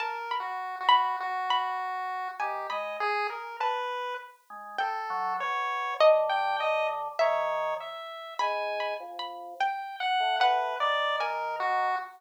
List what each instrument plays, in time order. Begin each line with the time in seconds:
0.00 lead 1 (square) A#4, harpsichord A5
0.31 harpsichord B5
0.40 lead 1 (square) F#4
0.81 lead 1 (square) F#4
0.89 harpsichord B5
1.20 lead 1 (square) F#4
1.50 harpsichord B5
2.40 drawbar organ D#3, lead 1 (square) G4, harpsichord G#5
2.70 drawbar organ G#3, lead 1 (square) D#5, harpsichord B5
3.00 lead 1 (square) G#4
3.30 lead 1 (square) A#4
3.60 lead 1 (square) B4, harpsichord A5
4.50 drawbar organ G#3
4.79 lead 1 (square) A4, harpsichord G5
5.10 drawbar organ F#3
5.40 drawbar organ B2, lead 1 (square) C#5
6.00 drawbar organ D3, harpsichord D#5
6.29 lead 1 (square) G5
6.60 lead 1 (square) D#5
7.19 drawbar organ D#3, lead 1 (square) C#5, harpsichord E5
7.81 lead 1 (square) E5
8.39 drawbar organ G#2, lead 1 (square) G#5, harpsichord B5
8.80 harpsichord B5
9.00 drawbar organ F2
9.19 harpsichord B5
9.60 lead 1 (square) G5, harpsichord G5
10.00 lead 1 (square) F#5
10.20 drawbar organ A2
10.40 lead 1 (square) B4, harpsichord F#5
10.80 drawbar organ D#3, lead 1 (square) D5
11.20 lead 1 (square) A#4, harpsichord G#5
11.60 lead 1 (square) F#4